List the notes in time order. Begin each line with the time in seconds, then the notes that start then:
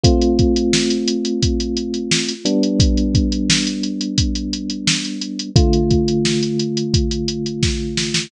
0.03 A3 C4 F4, kick, closed hi-hat
0.21 closed hi-hat
0.39 kick, closed hi-hat
0.56 closed hi-hat
0.73 snare
0.90 closed hi-hat
1.08 closed hi-hat
1.25 closed hi-hat
1.43 kick, closed hi-hat
1.60 closed hi-hat
1.77 closed hi-hat
1.94 closed hi-hat
2.11 snare
2.28 closed hi-hat
2.45 G3 B3 D4, closed hi-hat
2.63 closed hi-hat
2.80 kick, closed hi-hat
2.97 closed hi-hat
3.15 kick, closed hi-hat
3.32 closed hi-hat
3.50 snare
3.67 closed hi-hat
3.83 closed hi-hat
4.01 closed hi-hat
4.18 kick, closed hi-hat
4.35 closed hi-hat
4.53 closed hi-hat
4.70 closed hi-hat
4.87 snare
5.05 closed hi-hat
5.21 closed hi-hat
5.39 closed hi-hat
5.56 D3 A3 F4, kick, closed hi-hat
5.73 closed hi-hat
5.91 kick, closed hi-hat
6.08 closed hi-hat
6.25 snare
6.43 closed hi-hat
6.59 closed hi-hat
6.77 closed hi-hat
6.94 kick, closed hi-hat
7.11 closed hi-hat
7.28 closed hi-hat
7.46 closed hi-hat
7.63 kick, snare
7.97 snare
8.14 snare